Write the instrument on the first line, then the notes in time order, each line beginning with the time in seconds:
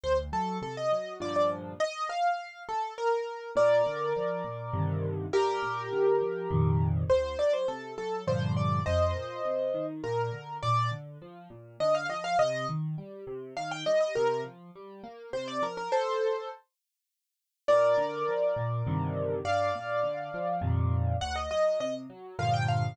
acoustic grand piano
0.04 D2 C5
0.32 F#3 A4
0.62 C3 A4
0.77 D#5
0.92 F#3
1.20 G2 A#2 D3 F3 D5
1.36 D5
1.80 D#5
2.09 F5
2.69 A4
2.98 A#4
3.56 A#2 A#4 D5
3.87 D3
4.17 F3
4.44 A#2
4.73 G2 C3 D3 D#3
5.33 G2 G4 A#4
5.63 A#2
5.92 D3
6.21 F3
6.51 F2 A#2 C3 D#3
7.10 D2 C5
7.38 F#3 D5
7.53 C5
7.68 C3 A4
7.98 F#3 A4
8.27 G2 A#2 D3 F3 C5
8.57 D5
8.86 F2 C5 D#5
9.15 A#2
9.45 C3
9.74 D#3
10.04 A#2 A#4
10.32 D3
10.63 A#2 D5
10.91 D3
11.22 F3
11.50 A#2
11.80 D3 D#5
11.95 F5
12.09 F3 D#5
12.24 F5
12.39 C3 D#5
12.69 D#3
12.98 G3
13.27 C3
13.57 D#3 F5
13.71 G5
13.86 G3 D#5
14.01 D#5
14.15 C3 A#4
14.44 F3
14.75 G3
15.04 A#3
15.33 C3 C5
15.48 D5
15.62 F3 A#4
15.77 A#4
15.92 A4 C5
17.68 A#2 A#4 D5
17.97 D3
18.28 F3
18.56 A#2
18.87 G2 C3 D3 D#3
19.45 G2 D5 F5
19.75 A#2
20.03 D3
20.34 F3
20.61 F2 A#2 C3 D#3
21.21 D2 F#5
21.36 D#5
21.51 F#3 D#5
21.80 C3 D#5
22.10 F#3
22.39 G2 A#2 D3 F3 F5
22.54 G5
22.69 F5